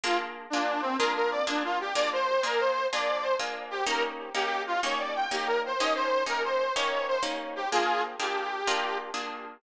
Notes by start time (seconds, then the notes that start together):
0.04 A#3 D4 F4 G#4
0.50 A#3 D4 F4 G#4
0.81 C4
0.98 A#3 D4 F4 G#4 A#4
1.15 A#4
1.31 D5
1.47 A#3 D4 F4 G#4
1.65 F4
1.80 G4
1.95 A#3 D4 F4 G#4 D5
2.13 C5
2.43 A#3 D4 F4 G#4 A#4
2.60 C5
2.93 A#3 D4 F4 G#4 D5
3.23 C5
3.39 A#3 D4 F4 G#4
3.71 G4
3.86 A#3 C#4 D#4 G4 A#4
4.34 A#3 C#4 D#4 G4
4.67 F4
4.83 A#3 C#4 D#4 G4 C#5
4.99 D5
5.15 G5
5.31 A#3 C#4 D#4 G4
5.47 A#4
5.66 C5
5.80 A#3 C#4 D#4 G4 D#5
5.95 C5
6.26 A#3 C#4 D#4 G4 A#4
6.44 C5
6.75 A#3 C#4 D#4 G4 C#5
7.08 C5
7.23 A#3 C#4 D#4 G4
7.56 G4
7.71 A#3 D4 F4 G#4
8.19 A#3 D4 F4 G4 G#4
8.67 A#3 D4 F4 G#4
9.14 A#3 D4 F4 G#4